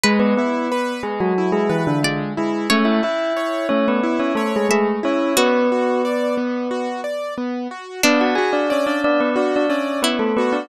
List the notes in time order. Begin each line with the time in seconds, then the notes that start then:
0.03 G#3 G#4 B4
0.19 B3 B4
0.37 B3 E4 B4
0.72 B4
1.03 G#3 G#4
1.20 F#3 F#4
1.38 E4
1.52 G#3 G#4
1.69 E3 E4 B4
1.87 D3 D4
2.03 D3 G#3 D4 D5
2.37 G#3 E4 G#4
2.70 A3 C#4 C#5
2.85 E4 E5
3.03 E4 E5
3.37 C#5
3.69 A3 C#4 C#5
3.88 B3 B4
4.03 E4
4.19 C#4 C#5
4.35 A3 A4 C#5
4.56 G#3 G#4
4.69 G#3 A3 G#4 E5
5.03 C#4 E4 C#5
5.37 B3 F#4 B4
5.72 F#4
6.05 D5
6.37 B3
6.71 F#4
7.04 D5
7.38 B3
7.71 F#4
8.03 B3 D4 D5
8.21 F#4 F#5
8.35 F#4 G#4 G#5
8.53 D4 D5
8.70 C#4 C#5 D5
8.87 D4 D5
9.04 B3 D4 D5
9.20 B3 B4
9.36 D4 F#4 D5
9.56 D4 D5
9.69 C#4 C#5 D5
10.02 B3 E4 B4
10.19 A3 A4
10.37 B3 F#4 B4
10.53 D4 D5